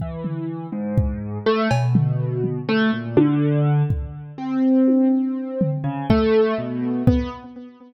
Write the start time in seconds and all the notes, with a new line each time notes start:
0.00 E3, kick
0.24 floor tom
0.72 G#2
0.98 kick
1.46 A3
1.71 B2, cowbell
1.95 floor tom
2.44 floor tom
2.69 A3
2.93 A#2
3.17 D3, high tom
3.90 kick
4.38 C4
4.88 high tom
5.61 floor tom
5.84 C#3
6.10 A3, kick
6.58 B2
7.07 B3, kick